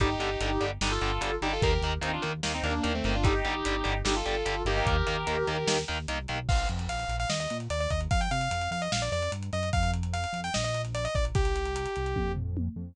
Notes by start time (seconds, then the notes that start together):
0.00 G1 D3 G3 D#4 G4, kick, closed hi-hat
0.19 G1 D3 G3, closed hi-hat
0.41 G1 D3 G3, closed hi-hat
0.60 G1 D3 G3, closed hi-hat
0.81 G1 D3 G3 D#4 G4, snare
0.91 F4 A4
1.01 G1 D3 G3, closed hi-hat
1.21 G1 D3 G3, closed hi-hat
1.41 G1 D3 G3 D#4 G4, closed hi-hat
1.52 F4 A4
1.61 D#2 D#3 A#3 G4 A#4, kick, closed hi-hat
1.72 G4 A#4
1.82 D#2 D#3 A#3, closed hi-hat
2.01 D#2 D#3 A#3 C4 D#4, closed hi-hat
2.13 D4 F4
2.22 D#2 D#3 A#3, closed hi-hat
2.43 D#2 D#3 A#3, snare
2.53 C4 D#4
2.63 D#2 D#3 A#3 D4, closed hi-hat
2.83 D#2 D#3 A#3, closed hi-hat
2.94 A3 C4
3.04 G1 D#3 A#3, closed hi-hat
3.14 D4 F4
3.23 D3 G3 D#4 G4, kick, closed hi-hat
3.45 G1 D3 G3, closed hi-hat
3.65 G1 D3 G3, closed hi-hat
3.84 G1 D3 G3, closed hi-hat
4.05 G1 D3 G3 D#4 G4, snare
4.15 F4 A4
4.26 G1 D3 G3, closed hi-hat
4.45 G1 D3 G3, closed hi-hat
4.65 G1 D#3 A#3 D#4 G4, closed hi-hat
4.76 D#4 G4
4.85 D#2 G4 A#4, kick, closed hi-hat
5.07 D#2 D#3 A#3, closed hi-hat
5.27 D#2 D#3 A#3, closed hi-hat
5.47 D#2 D#3 A#3, closed hi-hat
5.67 D#2 D#3 A#3, snare
5.88 D#2 D#3 A#3, closed hi-hat
6.08 C2 D#3 A#3, closed hi-hat
6.28 B1 D#3 A#3, closed hi-hat
6.49 A#1 F5, kick, crash
6.59 closed hi-hat
6.69 F2, closed hi-hat
6.79 closed hi-hat
6.88 A#1 F5, closed hi-hat
6.99 closed hi-hat
7.08 A#1, closed hi-hat
7.20 F5, closed hi-hat
7.29 D#2 D#5, snare
7.40 D#5, closed hi-hat
7.50 A#2, closed hi-hat
7.60 closed hi-hat
7.70 D#2 D5, closed hi-hat
7.80 D5, closed hi-hat
7.90 D#2 D#5, kick, closed hi-hat
8.01 closed hi-hat
8.11 F2 F5, kick, closed hi-hat
8.21 G5, closed hi-hat
8.31 C3 F5, closed hi-hat
8.41 closed hi-hat
8.51 F2, closed hi-hat
8.61 closed hi-hat
8.71 F2 F5, closed hi-hat
8.82 D#5, closed hi-hat
8.92 A#1 F5, snare
9.02 D5, closed hi-hat
9.12 F2 D5, closed hi-hat
9.22 closed hi-hat
9.32 G2, closed hi-hat
9.43 closed hi-hat
9.53 F#2 D#5, closed hi-hat
9.63 closed hi-hat
9.73 F2 F5, kick, closed hi-hat
9.83 closed hi-hat
9.93 closed hi-hat
10.03 closed hi-hat
10.13 F5, closed hi-hat
10.24 closed hi-hat
10.33 F2, closed hi-hat
10.44 G5, closed hi-hat
10.54 A#1 D#5, snare
10.64 D#5, closed hi-hat
10.74 closed hi-hat
10.85 closed hi-hat
10.95 D5, closed hi-hat
11.05 D#5, closed hi-hat
11.15 A#1 D5, kick, closed hi-hat
11.25 closed hi-hat
11.35 C2 G4, kick, closed hi-hat
11.45 closed hi-hat
11.56 closed hi-hat
11.66 closed hi-hat
11.76 closed hi-hat
11.86 closed hi-hat
11.96 C2, closed hi-hat
12.06 closed hi-hat
12.16 F2, kick, high tom
12.36 floor tom
12.57 high tom
12.76 F2